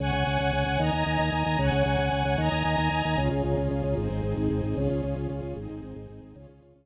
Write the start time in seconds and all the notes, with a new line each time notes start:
0.00 C#2 C#5 F#5 G#5
0.13 C#2
0.27 C#2
0.40 C#2
0.53 C#2
0.66 C#2
0.79 D#2 D#5 G#5 A#5
0.93 D#2
1.06 D#2
1.19 D#2
1.32 D#2
1.46 D#2
1.59 C#2 C#5 F#5 G#5
1.72 C#2
1.85 C#2
1.98 C#2
2.12 C#2
2.25 C#2
2.38 D#2 D#5 G#5 A#5
2.52 D#2
2.65 D#2
2.78 D#2
2.91 D#2
3.05 D#2
3.18 C#2 C#4 F4 G#4
3.31 C#2
3.44 C#2
3.57 C#2
3.71 C#2
3.84 C#2
3.97 G#1 C4 D#4 G#4
4.10 G#1
4.24 G#1
4.37 G#1
4.50 G#1
4.64 G#1
4.77 C#2 C#4 F4 G#4
4.90 C#2
5.04 C#2
5.16 C#2
5.30 C#2
5.43 C#2
5.56 G#1 C4 D#4 G#4
5.70 G#1
5.83 G#1
5.96 G#1
6.09 G#1
6.23 G#1
6.36 C#2 C#4 F4 G#4
6.49 C#2
6.63 C#2
6.76 C#2